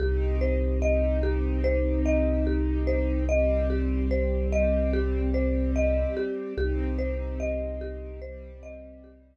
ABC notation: X:1
M:4/4
L:1/8
Q:1/4=73
K:Cm
V:1 name="Marimba"
G c e G c e G c | e G c e G c e G | G c e G c e G z |]
V:2 name="String Ensemble 1"
[CEG]8 | [G,CG]8 | [CEG]4 [G,CG]4 |]
V:3 name="Synth Bass 2" clef=bass
C,,8- | C,,8 | C,,8 |]